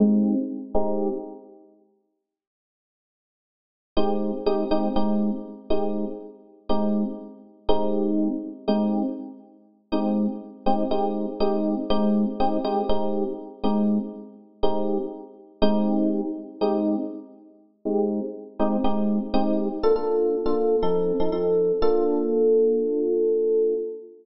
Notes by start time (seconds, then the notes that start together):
0.00 G#3 C4 D#4 G4
0.74 G#3 C4 D#4 G4
3.97 G#3 C4 D#4 G4
4.46 G#3 C4 D#4 G4
4.71 G#3 C4 D#4 G4
4.96 G#3 C4 D#4 G4
5.70 G#3 C4 D#4 G4
6.69 G#3 C4 D#4 G4
7.69 G#3 C4 D#4 G4
8.68 G#3 C4 D#4 G4
9.92 G#3 C4 D#4 G4
10.66 G#3 C4 D#4 G4
10.91 G#3 C4 D#4 G4
11.40 G#3 C4 D#4 G4
11.90 G#3 C4 D#4 G4
12.40 G#3 C4 D#4 G4
12.64 G#3 C4 D#4 G4
12.89 G#3 C4 D#4 G4
13.64 G#3 C4 D#4 G4
14.63 G#3 C4 D#4 G4
15.62 G#3 C4 D#4 G4
16.61 G#3 C4 D#4 G4
17.85 G#3 C4 D#4 G4
18.59 G#3 C4 D#4 G4
18.84 G#3 C4 D#4 G4
19.34 G#3 C4 D#4 G4
19.83 A#3 D4 F4 A4
19.96 A#3 D4 F4 A4
20.46 A#3 D4 F4 A4
20.83 F3 C4 D#4 A4
21.20 F3 C4 D#4 A4
21.32 F3 C4 D#4 A4
21.82 A#3 D4 F4 A4